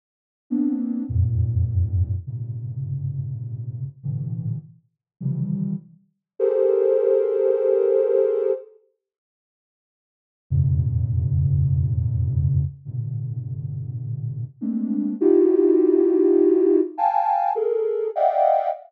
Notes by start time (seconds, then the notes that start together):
0.50 A#3 B3 C4 D4
1.09 E2 F2 F#2 G#2 A#2
2.27 G2 G#2 A#2 C3 C#3
4.03 G#2 A2 A#2 C3 D3 E3
5.20 C3 C#3 D#3 E3 F3 G3
6.39 G4 G#4 A4 A#4 C5
10.50 E2 F2 G2 A2 B2 C#3
12.85 G2 A2 A#2 B2 C3 D3
14.61 G#3 A3 A#3 C4 D4
15.21 D#4 E4 F4 F#4 G4
16.97 F5 G5 G#5 A5
17.55 G#4 A4 A#4
18.15 D5 D#5 E5 F5 F#5 G5